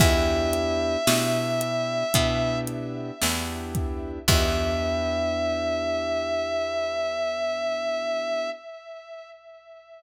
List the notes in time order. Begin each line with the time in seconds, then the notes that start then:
0.00 E2 B3 D4 E4 G4 E5, kick, crash
0.53 closed hi-hat
1.07 B2 B3 D4 E4 G4, snare
1.61 closed hi-hat
2.14 B2 B3 D4 E4 G4, kick, closed hi-hat
2.67 closed hi-hat
3.22 E2 B3 D4 E4 G4, snare
3.75 kick, closed hi-hat
4.28 E2 B3 D4 E4 G4 E5, kick, crash